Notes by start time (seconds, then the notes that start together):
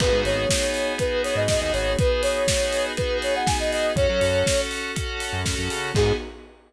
0.00 G#1 B3 D#4 F#4 G#4 B4, kick, crash
0.13 G#2
0.24 G#1 C#5, open hi-hat
0.49 B3 D#4 F#4 G#4, kick, snare
0.74 open hi-hat
0.98 B3 D#4 F#4 G#4 B4, kick, closed hi-hat
1.24 C#5, open hi-hat
1.36 G#2 D#5
1.48 B3 D#4 F#4 G#4 D#5, kick, snare
1.61 D#2 D#5
1.73 G#1 C#5, open hi-hat
1.98 B3 D#4 F#4 G#4 B4, kick, closed hi-hat
2.22 C#5, open hi-hat
2.48 B3 D#4 F#4 G#4, kick, snare
2.73 open hi-hat
2.97 B3 D#4 F#4 G#4 B4, kick, closed hi-hat
3.22 C#5, open hi-hat
3.36 F#5
3.46 B3 D#4 F#4 G#4 G#5, kick, snare
3.60 D#5
3.73 D#5, open hi-hat
3.96 F#2 C#4 F#4 A4 C#5, kick, closed hi-hat
4.09 F#3
4.21 F#2, open hi-hat
4.46 C#4 F#4 A4, kick, snare
4.71 open hi-hat
4.96 C#4 F#4 A4, kick, closed hi-hat
5.20 open hi-hat
5.33 F#2
5.45 C#4 F#4 A4, kick, snare
5.58 F#2
5.70 C#3, open hi-hat
5.95 G#2 B3 D#4 F#4 G#4, kick, crash